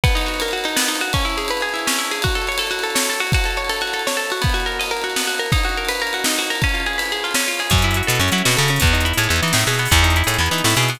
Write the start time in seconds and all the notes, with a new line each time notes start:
0.04 B3, kick, ride
0.09 ride
0.15 D#4, ride
0.21 ride
0.26 F#4, ride
0.34 ride
0.40 A#4, ride
0.48 ride
0.51 F#4, ride
0.58 ride
0.64 D#4, ride
0.69 ride
0.76 B3, snare
0.84 ride
0.88 D#4, ride
0.95 ride
1.01 F#4, ride
1.08 ride
1.13 C#4, kick, ride
1.19 ride
1.25 E4, ride
1.30 ride
1.37 G#4, ride
1.45 ride
1.48 B4, ride
1.57 ride
1.61 G#4, ride
1.69 ride
1.74 E4, ride
1.79 ride
1.87 C#4, snare
1.93 ride
1.98 E4, ride
2.05 ride
2.11 G#4, ride
2.16 ride
2.22 F#4, kick, ride
2.29 ride
2.35 A4, ride
2.42 ride
2.47 C#5, ride
2.52 ride
2.58 A4, ride
2.67 F#4, ride
2.72 ride
2.79 ride
2.83 A4, ride
2.90 ride
2.95 C#5, snare
3.03 ride
3.09 A4, ride
3.13 ride
3.20 F#4, ride
3.27 ride
3.32 F#4, kick, ride
3.39 ride
3.44 A4, ride
3.51 ride
3.57 C#5, ride
3.65 ride
3.69 A4, ride
3.76 ride
3.81 F#4, ride
3.87 ride
3.93 A4, ride
3.99 ride
4.07 C#5, snare
4.11 ride
4.17 A4, ride
4.25 ride
4.30 F#4, ride
4.37 ride
4.42 B3, kick, ride
4.49 ride
4.54 F#4, ride
4.60 ride
4.66 A#4, ride
4.72 ride
4.80 D#5, ride
4.86 ride
4.91 A#4, ride
4.97 ride
5.02 F#4, ride
5.10 ride
5.16 B3, snare
5.21 ride
5.27 F#4, ride
5.34 ride
5.39 A#4
5.46 ride
5.52 D#4, kick, ride
5.58 ride
5.64 F#4, ride
5.69 ride
5.77 A#4, ride
5.85 ride
5.89 B4, ride
5.95 ride
6.00 A#4, ride
6.07 ride
6.13 F#4, ride
6.19 ride
6.24 D#4, snare
6.32 ride
6.38 F#4, ride
6.42 ride
6.50 A#4, ride
6.55 ride
6.62 C#4, kick, ride
6.69 ride
6.74 F4, ride
6.80 ride
6.86 G#4, ride
6.93 ride
6.98 B4, ride
7.06 ride
7.12 G#4, ride
7.17 ride
7.24 F4, ride
7.31 snare, ride
7.35 C#4
7.40 ride
7.46 F4, ride
7.54 ride
7.59 G#4, ride
7.67 closed hi-hat, ride
7.71 F#2 C#4, kick
7.78 closed hi-hat
7.82 E4, closed hi-hat
7.91 closed hi-hat
7.94 F#4, closed hi-hat
8.03 closed hi-hat
8.07 B2 A4, closed hi-hat
8.15 closed hi-hat
8.19 F#2 C#4, closed hi-hat
8.28 closed hi-hat
8.32 F#3 E4, closed hi-hat
8.38 closed hi-hat
8.45 B2 F#4, snare
8.52 closed hi-hat
8.57 C#3 A4, closed hi-hat
8.62 closed hi-hat
8.68 C#4, closed hi-hat
8.76 closed hi-hat
8.80 E2 B3, kick, closed hi-hat
8.87 closed hi-hat
8.93 D#4, closed hi-hat
9.01 closed hi-hat
9.05 E4, closed hi-hat
9.14 A2, closed hi-hat
9.18 G#4, closed hi-hat
9.23 closed hi-hat
9.29 E2 B3, closed hi-hat
9.36 closed hi-hat
9.43 E3 D#4, closed hi-hat
9.48 closed hi-hat
9.53 A2 E4, snare
9.61 closed hi-hat
9.67 B2 G#4, closed hi-hat
9.74 closed hi-hat
9.79 B3, closed hi-hat
9.85 open hi-hat
9.91 E2 B3, kick, closed hi-hat
9.98 closed hi-hat
10.03 D#4, closed hi-hat
10.10 closed hi-hat
10.16 E4, closed hi-hat
10.24 A2 G#4, closed hi-hat
10.28 closed hi-hat
10.34 closed hi-hat
10.38 E2 B3
10.46 closed hi-hat
10.51 E3 D#4, closed hi-hat
10.58 closed hi-hat
10.64 A2 E4, snare
10.70 closed hi-hat
10.76 B2 G#4, closed hi-hat
10.82 closed hi-hat
10.88 B3, closed hi-hat
10.95 open hi-hat